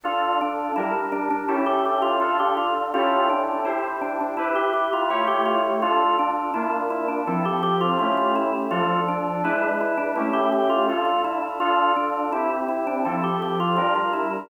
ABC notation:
X:1
M:4/4
L:1/16
Q:1/4=83
K:Dm
V:1 name="Drawbar Organ"
F2 D2 E z D D E G G F F G F z | F2 D2 E z D D E G G F F G F z | F2 D2 E z E D E G G F F F E z | F2 D2 E z E D E G G F F F E z |
F2 D2 E z E D E G G F F F E z |]
V:2 name="Electric Piano 2"
[DFA]4 [G,DB]4 [^CEGA]4 [DFA]4 | [^CEGA]4 [EG=c]4 [EG=B]4 [A,EG^c]4 | [DFA]4 [B,DF]4 [F,CA]4 [A,^CEG]4 | [F,DA]4 [^G,DE=B]4 [A,^CE=G]4 [DFA]4 |
[DFA]4 [CEG]4 [F,CA]4 [G,DB]4 |]